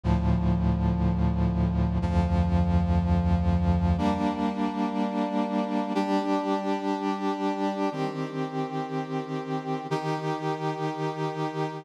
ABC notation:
X:1
M:4/4
L:1/8
Q:1/4=61
K:Bb
V:1 name="Brass Section"
[D,,A,,F,]4 [D,,F,,F,]4 | [G,B,D]4 [G,DG]4 | [E,CG]4 [E,EG]4 |]